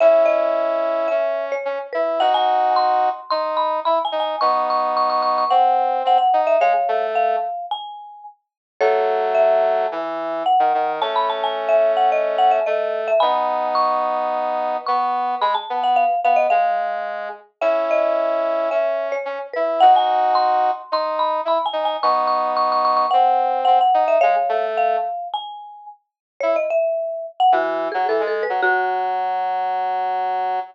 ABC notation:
X:1
M:4/4
L:1/16
Q:1/4=109
K:F#dor
V:1 name="Marimba"
e2 d6 e3 c3 B2 | f g3 =c'4 c'2 b2 (3b2 g2 g2 | c'2 c'2 c' c' c' c' f4 f f2 e | [c^e]4 e4 g4 z4 |
[Ac]4 e8 f4 | a b a g2 e2 f d2 f e d3 e | [gb]4 c'8 c'4 | b a2 f ^e2 e d e6 z2 |
e2 d6 e3 c3 B2 | f g3 =c'4 c'2 b2 (3b2 g2 g2 | c'2 c'2 c' c' c' c' f4 f f2 e | [c^e]4 e4 g4 z4 |
c d e5 f F3 G (3A2 A2 B2 | F16 |]
V:2 name="Brass Section"
[CE]8 C4 C z E2 | [DF]8 D4 E z D2 | [B,D]8 ^B,4 B, z D2 | G, z A,4 z10 |
[F,A,]8 E,4 z D, D,2 | [A,C]12 A,4 | [B,D]12 B,4 | G, z B,3 z B,2 G,6 z2 |
[CE]8 C4 C z E2 | [DF]8 D4 E z D2 | [B,D]8 ^B,4 B, z D2 | G, z A,4 z10 |
E z7 E,3 F, E, G,2 F, | F,16 |]